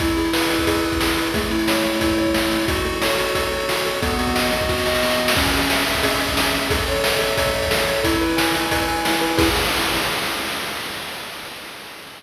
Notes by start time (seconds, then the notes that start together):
0.00 E4, kick, closed hi-hat
0.08 closed hi-hat
0.17 G#4, closed hi-hat
0.25 closed hi-hat
0.33 B4, snare
0.42 closed hi-hat
0.50 E4, closed hi-hat
0.59 kick, closed hi-hat
0.67 G#4, kick, closed hi-hat
0.75 closed hi-hat
0.84 B4, closed hi-hat
0.92 kick, closed hi-hat
1.00 E4, snare
1.09 closed hi-hat
1.17 G#4, closed hi-hat
1.26 closed hi-hat
1.34 A3, kick, closed hi-hat
1.42 closed hi-hat
1.51 E4, closed hi-hat
1.59 closed hi-hat
1.68 C#5, snare
1.76 closed hi-hat
1.84 A3, closed hi-hat
1.93 closed hi-hat
2.00 E4, kick, closed hi-hat
2.10 kick, closed hi-hat
2.18 C#5, closed hi-hat
2.26 kick, closed hi-hat
2.34 A3, snare
2.43 closed hi-hat
2.50 E4, closed hi-hat
2.60 open hi-hat
2.68 F#4, kick, closed hi-hat
2.76 closed hi-hat
2.85 A4, closed hi-hat
2.93 closed hi-hat
3.02 C#5, snare
3.10 closed hi-hat
3.18 F#4, closed hi-hat
3.27 closed hi-hat
3.34 A4, kick, closed hi-hat
3.44 closed hi-hat
3.52 C#5, closed hi-hat
3.60 closed hi-hat
3.69 F#4, snare
3.77 closed hi-hat
3.85 A4, closed hi-hat
3.94 closed hi-hat
4.02 B3, kick, closed hi-hat
4.10 closed hi-hat
4.19 F#4, closed hi-hat
4.27 kick, closed hi-hat
4.35 D#5, snare
4.44 closed hi-hat
4.52 B3, closed hi-hat
4.61 kick, closed hi-hat
4.69 F#4, kick, snare
4.78 snare
4.86 D#5, snare
4.95 snare
5.02 B3, snare
5.11 snare
5.19 F#4
5.28 snare
5.36 C#4, kick, crash
5.45 closed hi-hat
5.53 G#4, closed hi-hat
5.61 closed hi-hat
5.70 E5, snare
5.78 closed hi-hat
5.86 C#4, closed hi-hat
5.95 kick, closed hi-hat
6.03 G#4, kick, closed hi-hat
6.12 closed hi-hat
6.20 E5, closed hi-hat
6.28 kick, closed hi-hat
6.36 C#4, snare
6.45 closed hi-hat
6.53 G#4, closed hi-hat
6.62 closed hi-hat
6.70 A4, kick, closed hi-hat
6.79 closed hi-hat
6.87 C#5, closed hi-hat
6.96 closed hi-hat
7.04 E5, snare
7.12 closed hi-hat
7.19 A4, closed hi-hat
7.29 closed hi-hat
7.37 C#5, kick, closed hi-hat
7.46 kick, closed hi-hat
7.54 E5, closed hi-hat
7.62 kick, closed hi-hat
7.71 A4, snare
7.79 closed hi-hat
7.88 C#5, closed hi-hat
7.96 closed hi-hat
8.04 E4, kick, closed hi-hat
8.13 closed hi-hat
8.21 B4, closed hi-hat
8.30 closed hi-hat
8.37 G#5, snare
8.46 closed hi-hat
8.55 E4, closed hi-hat
8.63 closed hi-hat
8.71 B4, kick, closed hi-hat
8.80 closed hi-hat
8.88 G#5, closed hi-hat
8.97 closed hi-hat
9.05 E4, snare
9.13 closed hi-hat
9.21 B4, closed hi-hat
9.30 closed hi-hat
9.37 E4 G#4 B4, kick, crash